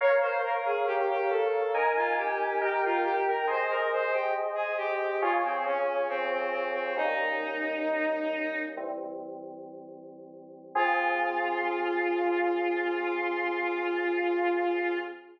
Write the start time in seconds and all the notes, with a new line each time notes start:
0.01 A#4 C#5 F5
0.21 C5
0.43 A#4
0.65 G#4
0.87 G4
1.10 G4
1.30 A4
1.74 D#4 A#4 G#5
1.96 F4
2.17 G4
2.61 D#4 G4 A#4 G5
2.85 F4
3.04 G4
3.28 A#4
3.47 G#4 C5 D#5
3.70 A#4
3.93 C5
4.13 G4
4.55 G#4
4.77 G4
5.21 F4 G#4 C#5
5.44 C4
5.65 C#4
6.09 C4
6.32 C4
6.51 C4
6.74 C4
6.96 G3 A#3 C#4 D#4
8.77 E3 G3 C4
10.75 F3 C4 F4 G#4